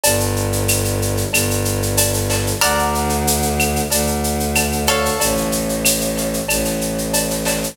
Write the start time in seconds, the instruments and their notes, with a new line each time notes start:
0.03 violin G1, cowbell, shaker
0.20 shaker
0.36 shaker
0.53 shaker
0.68 claves, shaker
0.85 shaker
1.02 shaker
1.17 shaker
1.33 violin G1, cowbell, claves, shaker
1.51 shaker
1.65 shaker
1.82 shaker
1.97 cowbell, shaker
2.14 shaker
2.30 snare, cowbell, shaker
2.47 shaker
2.61 violin D2, harpsichord A#4 D5 F#5, cowbell, claves, shaker
2.79 shaker
2.95 shaker
3.09 shaker
3.27 shaker
3.42 shaker
3.59 claves, shaker
3.76 shaker
3.91 violin D2, cowbell, shaker
4.07 shaker
4.24 shaker
4.40 shaker
4.55 cowbell, claves, shaker
4.72 shaker
4.87 harpsichord A4 C#5 F5, snare, cowbell, shaker
5.05 shaker
5.20 violin A1, cowbell, shaker
5.37 shaker
5.52 shaker
5.69 shaker
5.85 claves, shaker
6.01 shaker
6.18 shaker
6.33 shaker
6.48 violin A1, cowbell, claves, shaker
6.65 snare, shaker
6.81 shaker
6.98 shaker
7.13 cowbell, shaker
7.31 snare, shaker
7.45 snare, cowbell, shaker
7.62 snare, shaker